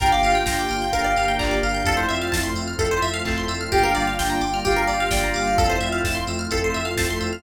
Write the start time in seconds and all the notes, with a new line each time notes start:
0.00 G1 A#3 D4 F4 G4 A#4 G5, kick, closed hi-hat
0.11 D5 F5
0.23 G1 A#3 D4 F4 G4 F5, open hi-hat
0.35 G5
0.46 G1 G5 A#5, kick, snare
0.59 D6
0.69 G1 F6, open hi-hat
0.82 G6
0.91 G1 A#3 D4 F4 G4 A#4 F5, kick, closed hi-hat
1.04 D5
1.16 G1 F5, open hi-hat
1.28 G5
1.38 G1 A#3 D4 F4 G4 D5 A#5, kick, clap
1.51 D6
1.63 G1 F5 F6, open hi-hat
1.75 G6
1.85 F2 A3 C4 E4 F4 A4, kick, closed hi-hat
1.97 C5
2.09 F2 A3 C4 E4 F4 E5, open hi-hat
2.22 F5
2.32 F2 A5, kick, snare
2.43 C6
2.54 F2 E6, open hi-hat
2.68 F6
2.79 F2 A3 C4 E4 F4 A4, kick, closed hi-hat
2.91 C5
3.02 F2 E5, open hi-hat
3.14 F5
3.25 F2 A3 C4 E4 F4 A5, kick, clap
3.38 C6
3.48 F2 E6, open hi-hat
3.61 F6
3.71 G1 G3 A#3 D4 F4 G4 G5, kick, closed hi-hat
3.83 A#4 F5
3.95 G1 G3 A#3 D4 F4 D5 F5, open hi-hat
4.07 F5
4.19 G1 G5, kick, snare
4.30 A#5
4.41 G1 D6, open hi-hat
4.54 F6
4.65 G1 G3 A#3 D4 F4 G4 F5, kick, closed hi-hat
4.76 A#4
4.87 G1 D5, open hi-hat
5.00 F5
5.10 G1 G3 A#3 D4 F4 D5 G5, kick, snare
5.24 A#5
5.34 G1 F5 D6, open hi-hat
5.48 F6
5.57 F2 A3 C4 E4 F4 A4, kick, closed hi-hat
5.70 C5
5.80 F2 A3 C4 E4 F4 E5, open hi-hat
5.92 F5
6.04 F2 A5, kick, snare
6.15 C6
6.27 F2 E6, open hi-hat
6.39 F6
6.49 F2 A3 C4 E4 F4 A4, kick, closed hi-hat
6.64 C5
6.74 F2 E5, open hi-hat
6.85 F5
6.97 F2 A3 C4 E4 F4 A5, kick, snare
7.10 C6
7.21 F2 E6, open hi-hat
7.33 F6